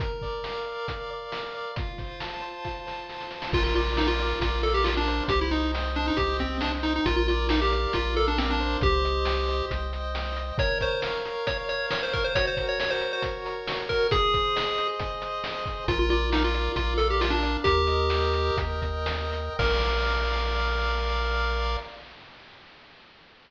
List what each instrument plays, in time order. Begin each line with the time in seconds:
0.00 lead 1 (square) A#4, kick, closed hi-hat
0.22 lead 1 (square) D5, kick, snare
0.44 lead 1 (square) F5, snare
0.66 lead 1 (square) D5
0.88 lead 1 (square) A#4, kick, closed hi-hat
1.10 lead 1 (square) D5
1.32 lead 1 (square) F5, snare
1.54 lead 1 (square) D5
1.76 lead 1 (square) F4, kick, closed hi-hat
1.98 lead 1 (square) C5, kick, snare
2.20 lead 1 (square) A5, snare
2.42 lead 1 (square) C5
2.65 lead 1 (square) F4, kick, snare
2.87 lead 1 (square) C5, snare
3.08 lead 1 (square) A5, snare
3.21 snare
3.31 lead 1 (square) C5, snare
3.42 snare
3.52 synth bass 1 A#1, lead 1 (square) F4 A#4, kick, crash
3.64 lead 1 (square) F4
3.75 lead 1 (square) F4 D5, closed hi-hat
3.97 lead 1 (square) D#4 F5, snare
4.08 lead 1 (square) F4
4.19 lead 1 (square) D5, closed hi-hat
4.40 synth bass 1 A#1, lead 1 (square) F4 A#4, kick, closed hi-hat
4.63 lead 1 (square) A4 D5, closed hi-hat
4.74 lead 1 (square) G4
4.84 lead 1 (square) F4 F5, snare
4.97 lead 1 (square) D4
5.08 lead 1 (square) C5, closed hi-hat
5.28 synth bass 1 C2, lead 1 (square) G4, kick, closed hi-hat
5.41 lead 1 (square) E4
5.51 lead 1 (square) D#4 D#5, closed hi-hat
5.74 lead 1 (square) G5, snare
5.95 lead 1 (square) D4 D#5, closed hi-hat
6.08 lead 1 (square) D#4
6.17 synth bass 1 C2, lead 1 (square) G4 C5, kick, closed hi-hat
6.39 lead 1 (square) C4 D#5, kick, closed hi-hat
6.61 lead 1 (square) D4 G5, snare
6.83 lead 1 (square) D#4 D#5, closed hi-hat
6.96 lead 1 (square) D#4
7.06 synth bass 1 A#1, lead 1 (square) F4 A#4, kick, closed hi-hat
7.16 lead 1 (square) F4
7.28 lead 1 (square) F4 D5, closed hi-hat
7.49 lead 1 (square) D#4 F5, snare
7.62 lead 1 (square) G4
7.72 lead 1 (square) D5, closed hi-hat
7.93 synth bass 1 A#1, lead 1 (square) F4 A#4, kick, closed hi-hat
8.16 lead 1 (square) A4 D5, closed hi-hat
8.28 lead 1 (square) D4
8.38 lead 1 (square) C4 F5, snare
8.50 lead 1 (square) D4
8.60 lead 1 (square) C5, closed hi-hat
8.81 synth bass 1 C2, lead 1 (square) G4, kick, closed hi-hat
9.04 lead 1 (square) D#5, closed hi-hat
9.25 lead 1 (square) G5, snare
9.48 lead 1 (square) D#5, closed hi-hat
9.71 synth bass 1 C2, lead 1 (square) C5, kick, closed hi-hat
9.93 lead 1 (square) D#5, closed hi-hat
10.15 lead 1 (square) G5, snare
10.36 lead 1 (square) D#5, closed hi-hat
10.58 lead 1 (square) A#4 C#5, kick, closed hi-hat
10.81 lead 1 (square) C5 C#5, kick, closed hi-hat
11.02 lead 1 (square) F5, snare
11.25 lead 1 (square) C#5, closed hi-hat
11.47 lead 1 (square) A#4 C#5, kick, closed hi-hat
11.69 lead 1 (square) C#5, closed hi-hat
11.91 lead 1 (square) C#5 F5, snare
12.03 lead 1 (square) C5
12.13 lead 1 (square) A#4 C#5, kick, closed hi-hat
12.24 lead 1 (square) C5
12.35 lead 1 (square) F#4 C#5, kick, closed hi-hat
12.47 lead 1 (square) C5
12.57 lead 1 (square) A#4, kick, closed hi-hat
12.69 lead 1 (square) C#5
12.79 lead 1 (square) C#5, snare
12.90 lead 1 (square) C5
13.01 lead 1 (square) A#4, closed hi-hat
13.13 lead 1 (square) C5
13.22 lead 1 (square) F#4, kick, closed hi-hat
13.45 lead 1 (square) A#4, closed hi-hat
13.67 lead 1 (square) C#5, snare
13.89 lead 1 (square) A#4, kick, closed hi-hat
14.11 lead 1 (square) G#4, kick, closed hi-hat
14.34 lead 1 (square) C5, kick, closed hi-hat
14.56 lead 1 (square) D#5, snare
14.78 lead 1 (square) C5, closed hi-hat
15.00 lead 1 (square) G#4, kick, closed hi-hat
15.22 lead 1 (square) C5, closed hi-hat
15.44 lead 1 (square) D#5, snare
15.66 lead 1 (square) C5, kick, closed hi-hat
15.88 synth bass 1 A#1, lead 1 (square) F4 A#4, kick, closed hi-hat
15.99 lead 1 (square) F4
16.10 lead 1 (square) F4 D5, closed hi-hat
16.32 lead 1 (square) D#4 F5, snare
16.44 lead 1 (square) F4
16.54 lead 1 (square) D5, closed hi-hat
16.76 synth bass 1 A#1, lead 1 (square) F4 A#4, kick, closed hi-hat
16.98 lead 1 (square) A4 D5, closed hi-hat
17.10 lead 1 (square) G4
17.21 lead 1 (square) F4 F5, snare
17.30 lead 1 (square) D4
17.42 lead 1 (square) D5, closed hi-hat
17.64 synth bass 1 D#2, lead 1 (square) G4 A#4, kick, closed hi-hat
17.87 lead 1 (square) D#5, closed hi-hat
18.10 lead 1 (square) G5, snare
18.34 lead 1 (square) D#5, closed hi-hat
18.57 synth bass 1 D#2, lead 1 (square) A#4, kick, closed hi-hat
18.82 lead 1 (square) D#5, kick, closed hi-hat
19.06 lead 1 (square) G5, snare
19.32 lead 1 (square) D#5, closed hi-hat
19.59 synth bass 1 A#1, lead 1 (square) A#4 D5 F5, kick, crash